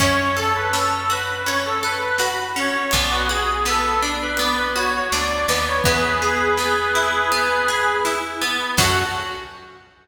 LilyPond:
<<
  \new Staff \with { instrumentName = "Accordion" } { \time 4/4 \key fis \minor \tempo 4 = 82 cis''8 a'16 b'16 a'8 b'8 cis''16 a'16 b'16 b'16 b'16 r16 cis''8 | d''16 fis'16 gis'8 a'8. b'16 d''16 b'16 cis''16 cis''16 d''8 d''16 cis''16 | <gis' b'>2. r4 | fis'4 r2. | }
  \new Staff \with { instrumentName = "Orchestral Harp" } { \time 4/4 \key fis \minor cis'8 a'8 cis'8 fis'8 cis'8 a'8 fis'8 cis'8 | b8 fis'8 b8 d'8 b8 fis'8 d'8 b8 | b8 gis'8 b8 e'8 b8 gis'8 e'8 b8 | <cis' fis' a'>4 r2. | }
  \new Staff \with { instrumentName = "Electric Bass (finger)" } { \clef bass \time 4/4 \key fis \minor fis,1 | b,,2. d,8 dis,8 | e,1 | fis,4 r2. | }
  \new DrumStaff \with { instrumentName = "Drums" } \drummode { \time 4/4 <cymc bd>4 sn4 hh4 sn4 | <hh bd>4 sn4 hh4 sn4 | <hh bd>4 sn4 hh4 sn4 | <cymc bd>4 r4 r4 r4 | }
>>